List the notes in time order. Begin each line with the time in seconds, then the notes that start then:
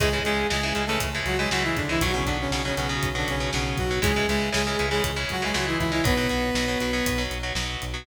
0.00 C#2 C#3 E3 G#3 G#4, kick, closed hi-hat
0.13 C#3 E3 G#3
0.24 C#2 C#3 E3 G#3 G#4, closed hi-hat
0.50 C#2 C#3 E3 G#3 G#4, snare
0.63 C#3 E3 G#3
0.75 C#2 C#3 E3 G#3, closed hi-hat
0.86 C#3 E3 G#3 A3 A4
1.00 C#2, kick, closed hi-hat
1.15 C#3 E3 G#3
1.26 C#2 F#3 F#4, closed hi-hat
1.38 C#3 E3 G#3 G#4
1.51 C#2 C#3 E3 F#3 G#3 F#4, snare
1.64 E3 E4
1.76 C#2 D3 D4, kick, closed hi-hat
1.89 C#3 E3 G#3 E4
2.01 B1 B2 F#3 F#4, kick, closed hi-hat
2.14 B2 C#3 F#3 C#4
2.25 B1 B2 D3 F#3 D4, kick, closed hi-hat
2.41 C#3 C#4
2.51 B1 B2 C#3 F#3 C#4, snare
2.65 B2 C#3 F#3 C#4
2.76 B1 B2 C#3 F#3 C#4, closed hi-hat
2.89 B2 F#3
3.03 B1, kick, closed hi-hat
3.15 B2 D3 F#3 D4
3.28 B1 C#3 C#4, closed hi-hat
3.40 B2 F#3
3.53 B1 B2 C#3 F#3 C#4, snare
3.77 B1 F#3 F#4, kick, closed hi-hat
3.91 B2 F#3
4.02 C#2 C#3 E3 G#3 G#4, kick, closed hi-hat
4.16 C#3 E3 G#3
4.28 C#2 C#3 E3 G#3 G#4, closed hi-hat
4.53 C#2 C#3 E3 G#3 G#4, snare
4.67 C#3 E3 G#3
4.79 C#2 C#3 E3 G#3, closed hi-hat
4.91 C#3 E3 G#3 G#4
5.04 C#2, kick, closed hi-hat
5.16 C#3 E3 G#3
5.29 C#2 F#3 F#4, kick, closed hi-hat
5.42 C#3 E3 G#3 G#4
5.53 C#2 C#3 E3 F#3 G#3 F#4, snare
5.67 E3 E4
5.79 C#2 E3 E4, kick, closed hi-hat
5.92 C#3 E3 G#3 E4
6.04 B1 B2 F#3 B3 B4, kick, closed hi-hat
6.17 B2 F#3
6.29 B1 B2 F#3, closed hi-hat
6.55 B1 B2 F#3, snare
6.68 B2 F#3
6.80 B1 B2 F#3, closed hi-hat
6.93 B2 F#3
7.06 B1, kick, closed hi-hat
7.18 B2 F#3
7.31 B1, closed hi-hat
7.43 B2 F#3
7.55 B1 B2 F#3, snare
7.82 B1, closed hi-hat
7.94 B2 F#3